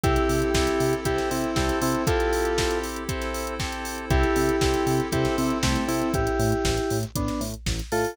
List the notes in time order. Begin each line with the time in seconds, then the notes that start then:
0.03 C2 C4 E4 G4 A4, kick, closed hi-hat
0.16 closed hi-hat
0.29 C3, open hi-hat
0.42 closed hi-hat
0.54 C2 C4 E4 G4 A4, kick, snare
0.67 closed hi-hat
0.80 C3, open hi-hat
0.93 closed hi-hat
1.05 C2 C4 E4 G4 A4 C5, kick, closed hi-hat
1.18 snare, closed hi-hat
1.31 C3 C4 E4, open hi-hat
1.44 closed hi-hat
1.56 C2 C4 E4 G4 A4, kick, snare
1.69 closed hi-hat
1.81 C3 C4 E4, open hi-hat
1.94 closed hi-hat
2.07 C4 E4 F4 G4 A4, kick, closed hi-hat
2.20 closed hi-hat
2.33 open hi-hat
2.45 closed hi-hat
2.58 C4 E4 G4 A4, kick, snare
2.71 closed hi-hat
2.83 open hi-hat
2.96 closed hi-hat
3.08 C4 E4 G4 A4 C5, kick, closed hi-hat
3.22 snare, closed hi-hat
3.34 open hi-hat
3.47 closed hi-hat
3.59 C4 E4 G4 A4, kick, snare
3.72 closed hi-hat
3.85 open hi-hat
3.98 closed hi-hat
4.10 C2 C4 E4 G4 A4, kick, closed hi-hat
4.23 closed hi-hat
4.36 C3, open hi-hat
4.49 closed hi-hat
4.61 C2 C4 E4 G4 A4, kick, snare
4.74 closed hi-hat
4.87 C3, open hi-hat
5.00 closed hi-hat
5.12 C2 C4 E4 G4 A4 C5, kick, closed hi-hat
5.25 snare, closed hi-hat
5.38 C3 C4 E4, open hi-hat
5.50 closed hi-hat
5.63 C2 A3 C4 E4 G4 A4, kick, snare
5.76 closed hi-hat
5.88 C3 C4 E4, open hi-hat
6.01 closed hi-hat
6.14 A1 E4 G4, kick, closed hi-hat
6.27 closed hi-hat
6.39 A2, open hi-hat
6.52 closed hi-hat
6.65 A1, kick, snare
6.77 closed hi-hat
6.90 A2, open hi-hat
7.03 closed hi-hat
7.15 A1 B3 D4, kick, closed hi-hat
7.28 snare, closed hi-hat
7.41 A2, open hi-hat
7.54 closed hi-hat
7.66 A1, kick, snare
7.79 closed hi-hat
7.92 A2 F4 A4, open hi-hat
8.04 open hi-hat